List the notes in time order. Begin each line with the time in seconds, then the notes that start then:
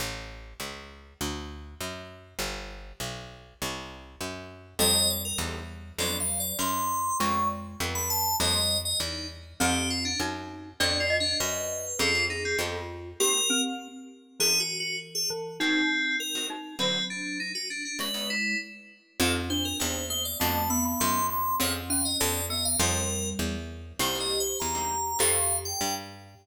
0.00 A1
0.60 C#2
1.21 D2
1.80 F#2
2.39 G1
3.00 B1
3.62 C2
4.21 F#2
4.79 F2 G3 C4 D#4 G4 A4 D#5
5.10 D5
5.25 A#4
5.38 E2 C4 D#4 G4 A4
5.98 F2 F#3 B3 C4 D4 F#4 D5
6.20 F5
6.40 D5
6.59 F#2 C6
7.20 F2 G#3 C4 C#4 F4 G#4 C#6
7.80 F2 F3 B3 F4 G4 A4
7.95 B5
8.10 A5
8.40 F2 G3 A#3 C4 D#4 G4 D#5
8.85 D#5
9.00 E2 D#4
9.60 F2 A3 C4 D#4 G4
9.90 F4
10.05 D4
10.20 F#2 D#4
10.80 F2 B3 C4 D4 F#4 D5
11.00 F4
11.10 D#5
11.20 D4
11.40 F#2 B4
11.99 F2 C4 C#4 F4 G#4
12.15 C4 C#4 F4 G#4
12.30 D#4
12.45 C4
12.59 F2 B3 F4 G4 A4
13.20 A#3 C4 D#4 G4 A#4
13.50 C4
14.40 E3 A#3 C#4 E4 G#4
14.60 F#4
14.80 F#4
15.15 G#4
15.30 E3
15.60 D#3 C4 D#4 F#4 A#4
16.20 A#4
16.35 D#3 C4 F#4 A#4
16.50 D#4
16.79 D3 F#3 C4 D#4 F#4
17.10 D4
17.40 D#4
17.55 F#4
17.70 D4
17.85 D4
17.99 C#3 G#3 B3 D#4 E4 B4
18.14 C#3 B3 D#4 E4
18.30 E4
19.20 F2 C4 D#4 G4 A4
19.50 D4 C5
19.65 A#4
19.80 E2 C4 D#4 G4 A4 C5
20.10 A#3 C5
20.25 D5
20.40 F2 A3 B3 C4 D4 F#4 A5
20.70 B3 B5
20.85 B5
21.00 F#2 C6
21.30 C6
21.60 F2 C4 C#4 F4 G#4 C#5
21.90 C#4 F5
22.05 D#5
22.20 F2 B3 F4 G4 A4 D5
22.50 B3 D#5
22.65 F5
22.80 F2 G3 A#3 C4 D#4 G4 A#4
23.39 E2
23.99 C2 G3 A#3 C4 D#4 G4 C5
24.15 G3 A#3 C4 D#4
24.20 D#5
24.40 C5
24.60 E2 A#5
24.75 G3 A#3 C4 D#4
25.19 F2 F3 G3 A3 C4 G4 F5
25.65 G5
25.81 G2